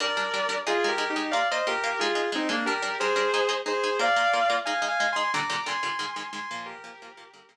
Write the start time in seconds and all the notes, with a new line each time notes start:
0.00 G3 D4 A#4 D5
0.17 G3 D4 A#4
0.34 G3 D4 A#4
0.49 G3 D4 A#4
0.67 G#3 D#4 F4 G#4
0.84 G#3 D#4 G#4
0.88 G4 A#4
0.98 G#3 D#4 G#4
1.10 D#4 G4
1.16 G#3 D#4 G#4
1.31 A#3 F4 A#4 D5 F5
1.51 A#3 F4 A#4 C5 D#5
1.67 A#3 F4 G4 A#4
1.84 A#3 F4 A#4
1.99 G#3 D#4 F4 G#4
2.15 G#3 D#4 G#4
2.32 G#3 C4 D#4 G#4
2.49 G#3 A#3 D4 D#4 G#4
2.66 G3 D4 G4 A#4
2.82 G3 D4 A#4
3.00 G3 D4 G#4 A#4 C5
3.16 G3 D4 A#4
3.34 G#3 D#4 G#4
3.49 G#3 D#4 G#4
3.66 G#3 D#4 G#4 C5
3.84 G#3 D#4 G#4
3.99 A#3 F4 A#4 D5 F5
4.16 A#3 F4 A#4
4.33 A#3 F4 A#4
4.50 A#3 F4 A#4
4.65 G#3 D#4 G#4 F5 G#5
4.82 G#3 D#4 G#4
4.88 F5 G#5
5.00 G#3 D#4 G#4
5.12 G#3 D#4 G#4 G#5 C6
5.34 A#2 D3 G3 A#5 D6
5.50 A#2 D3 G3
5.66 A#2 D3 G3 G#5 C6
5.83 A#2 D3 G3
5.99 G#2 D#3 G#3
6.16 G#2 D#3 G#3
6.33 G#2 D#3 G#3 G#5 C6
6.51 A#2 F3 A#3
6.66 G4 A#4
6.84 A#2 F3 A#3
7.02 A#2 F3 A#3
7.17 A#2 F3 A#3
7.34 G2 D3 A#3
7.49 G2 D3 A#3